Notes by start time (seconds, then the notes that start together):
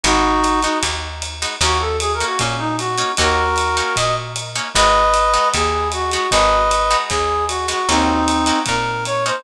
0.04 G#1 G#3 B3 D#4 F#4, kick, ride
0.44 hi-hat pedal, ride
0.62 G#3 B3 D#4 F#4, ride
0.83 D#2, kick, ride
1.22 hi-hat pedal, ride
1.42 G#3 B3 D#4 F#4, ride
1.61 D#2 A#3 C#4 D#4 F#4, kick, ride
1.80 A4
2.00 G#4, hi-hat pedal, ride
2.14 A#4
2.20 A#3 C#4 D#4 F#4, ride
2.26 F#4
2.39 A#2 C#4, kick, ride
2.59 D#4
2.78 F#4, hi-hat pedal, ride
2.98 A#3 C#4 D#4 F#4, ride
3.17 D#2 A#3 C#4 D#4 F#4 A#4, kick, ride
3.56 hi-hat pedal, ride
3.77 A#3 C#4 D#4 F#4, ride
3.96 A#2 D#5, kick, ride
4.36 hi-hat pedal, ride
4.55 A#3 C#4 D#4 F#4, ride
4.74 G#1 G#3 B3 D#4 F#4 B4 D#5, kick, ride
5.14 hi-hat pedal, ride
5.34 G#3 B3 D#4 F#4, ride
5.54 D#2 G#4, kick, ride
5.92 F#4, hi-hat pedal, ride
6.11 G#3 B3 D#4 F#4, ride
6.31 G#1 G#3 B3 D#4 F#4 B4 D#5, kick, ride
6.71 hi-hat pedal, ride
6.91 G#3 B3 D#4 F#4, ride
7.09 D#2 G#4, kick, ride
7.48 F#4, hi-hat pedal, ride
7.68 G#3 B3 D#4 F#4, ride
7.88 D#2 A#3 C4 C#4 D#4 F#4, kick, ride
8.28 hi-hat pedal, ride
8.46 A#3 C#4 D#4 F#4, ride
8.66 A#2 A#4, kick, ride
9.05 C#5, hi-hat pedal, ride
9.26 A#3 C#4 D#4 F#4 C5, ride